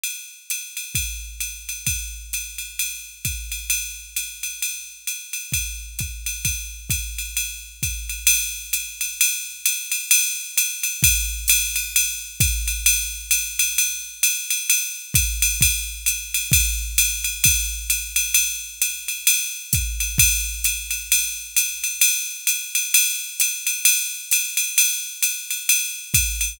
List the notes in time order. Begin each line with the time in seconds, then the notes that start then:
0.03 ride
0.50 hi-hat pedal, ride
0.77 ride
0.95 kick, ride
1.40 hi-hat pedal, ride
1.69 ride
1.86 kick, ride
2.33 hi-hat pedal, ride
2.58 ride
2.79 ride
3.25 kick, hi-hat pedal, ride
3.52 ride
3.70 ride
4.16 hi-hat pedal, ride
4.43 ride
4.62 ride
5.07 hi-hat pedal, ride
5.33 ride
5.52 kick, ride
5.99 kick, hi-hat pedal, ride
6.26 ride
6.45 kick, ride
6.90 kick, hi-hat pedal, ride
7.18 ride
7.37 ride
7.83 kick, hi-hat pedal, ride
8.09 ride
8.27 ride
8.73 hi-hat pedal, ride
9.01 ride
9.21 ride
9.66 hi-hat pedal, ride
9.92 ride
10.11 ride
10.58 hi-hat pedal, ride
10.83 ride
11.03 kick, ride
11.48 hi-hat pedal, ride
11.76 ride
11.96 ride
12.40 kick, hi-hat pedal, ride
12.68 ride
12.86 ride
13.31 hi-hat pedal, ride
13.59 ride
13.78 ride
14.23 hi-hat pedal, ride
14.50 ride
14.70 ride
15.14 kick, hi-hat pedal, ride
15.42 ride
15.61 kick, ride
16.06 hi-hat pedal, ride
16.34 ride
16.52 kick, ride
16.98 hi-hat pedal, ride
17.24 ride
17.44 kick, ride
17.90 hi-hat pedal, ride
18.16 ride
18.34 ride
18.82 hi-hat pedal, ride
19.08 ride
19.27 ride
19.73 kick, hi-hat pedal, ride
20.00 ride
20.18 kick, ride
20.64 hi-hat pedal, ride
20.91 ride
21.12 ride
21.56 hi-hat pedal, ride
21.84 ride
22.01 ride
22.47 hi-hat pedal, ride
22.75 ride
22.94 ride
23.40 hi-hat pedal, ride
23.67 ride
23.85 ride
24.31 hi-hat pedal, ride
24.57 ride
24.78 ride
25.23 hi-hat pedal, ride
25.50 ride
25.69 ride
26.14 kick, hi-hat pedal, ride
26.41 ride